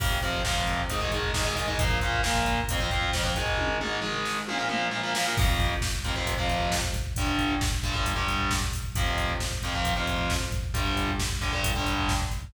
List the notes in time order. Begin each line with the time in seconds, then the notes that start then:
0.00 F2 C3 F3, kick, crash
0.11 kick
0.22 F2 C3 F3, kick, closed hi-hat
0.33 kick
0.45 F2 C3 F3, kick, snare
0.56 kick
0.67 kick, closed hi-hat
0.78 kick
0.90 G#2 D#3 G#3, kick, closed hi-hat
1.01 G#2 D#3 G#3, kick
1.12 G#2 D#3 G#3, kick, closed hi-hat
1.23 kick
1.34 G#2 D#3 G#3, kick, snare
1.45 G#2 D#3 G#3, kick
1.56 G#2 D#3 G#3, kick, open hi-hat
1.68 G#2 D#3 G#3, kick
1.79 A#2 F3 A#3, kick, closed hi-hat
1.90 kick
2.01 A#2 F3 A#3, kick, closed hi-hat
2.13 kick
2.23 A#2 F3 A#3, kick, snare
2.35 kick
2.46 kick, closed hi-hat
2.58 kick
2.69 F2 F3 C4, kick, closed hi-hat
2.80 F2 F3 C4, kick
2.91 F2 F3 C4, kick, closed hi-hat
3.02 kick
3.13 F2 F3 C4, kick, snare
3.24 F2 F3 C4, kick
3.36 G#2 D#3 G#3, kick, closed hi-hat
3.47 kick
3.58 kick, high tom
3.81 G#2 D#3 G#3, mid tom
4.02 G#2 D#3 G#3, floor tom
4.25 snare
4.48 A#2 F3 A#3, high tom
4.58 A#2 F3 A#3
4.69 A#2 F3 A#3, mid tom
4.91 A#2 F3 A#3
5.03 A#2 F3 A#3
5.15 A#2 F3 A#3, snare
5.25 A#2 F3 A#3
5.37 F2 C3 F3, kick, crash
5.49 kick
5.60 kick, closed hi-hat
5.71 kick
5.82 kick, snare
5.93 kick
6.04 F2 C3 F3, kick, closed hi-hat
6.16 F2 C3 F3, kick
6.27 kick, closed hi-hat
6.38 F2 C3 F3, kick
6.49 kick, closed hi-hat
6.60 kick
6.72 kick, snare
6.83 kick
6.94 kick, closed hi-hat
7.05 kick
7.16 G2 D3 G3, kick, closed hi-hat
7.27 kick
7.39 kick, closed hi-hat
7.50 kick
7.61 kick, snare
7.72 kick
7.83 G2 D3 G3, kick, closed hi-hat
7.94 G2 D3 G3, kick
8.06 kick, closed hi-hat
8.16 G2 D3 G3, kick
8.28 kick, closed hi-hat
8.40 kick
8.51 kick, snare
8.62 kick
8.73 kick, open hi-hat
8.84 kick
8.95 F2 C3 F3, kick, closed hi-hat
9.07 kick
9.18 kick, closed hi-hat
9.29 kick
9.40 kick, snare
9.51 kick
9.63 F2 C3 F3, kick, closed hi-hat
9.74 F2 C3 F3, kick
9.85 kick, closed hi-hat
9.96 F2 C3 F3, kick
10.07 kick, closed hi-hat
10.19 kick
10.30 kick, snare
10.41 kick
10.52 kick, closed hi-hat
10.64 kick
10.74 G2 D3 G3, kick, closed hi-hat
10.86 kick
10.97 kick, closed hi-hat
11.08 kick
11.19 kick, snare
11.31 kick
11.41 G2 D3 G3, kick, closed hi-hat
11.53 G2 D3 G3, kick
11.64 kick, closed hi-hat
11.75 G2 D3 G3, kick
11.86 kick, closed hi-hat
11.98 kick
12.09 kick, snare
12.20 kick
12.31 kick, closed hi-hat
12.43 kick